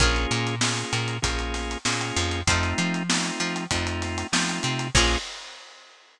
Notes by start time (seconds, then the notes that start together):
0.00 A#1 A#3 C#4 F4 G#4 A#4 C#5, kick, closed hi-hat
0.16 closed hi-hat
0.31 A#2 A#3, closed hi-hat
0.47 closed hi-hat
0.61 A#3 C#4 F4 G#4, snare
0.77 snare, closed hi-hat
0.93 A#2 A#3, closed hi-hat
1.08 closed hi-hat
1.22 A#1 A#3 C#4 F4 G#4, kick, closed hi-hat
1.39 closed hi-hat
1.54 snare, closed hi-hat
1.71 closed hi-hat
1.85 A#2 A#3 C#4 F4 G#4, snare
2.01 closed hi-hat
2.16 F2 F3, closed hi-hat
2.31 closed hi-hat
2.47 F2 A3 C4 D#4 F4 A4 C5, kick, closed hi-hat
2.63 snare, closed hi-hat
2.78 F3 F4, closed hi-hat
2.94 closed hi-hat
3.09 A3 C4 D#4 F4, snare
3.24 closed hi-hat
3.40 F3 F4, snare, closed hi-hat
3.56 closed hi-hat
3.71 F2 F3 A3 C4 D#4 F4, kick, closed hi-hat
3.87 closed hi-hat
4.02 snare, closed hi-hat
4.18 snare, closed hi-hat
4.32 F3 A3 C4 D#4 F4, snare
4.49 closed hi-hat
4.63 C3 C4, closed hi-hat
4.79 closed hi-hat
4.95 A#1 A#3 C#4 F4 G#4 A#4 C#5, kick, crash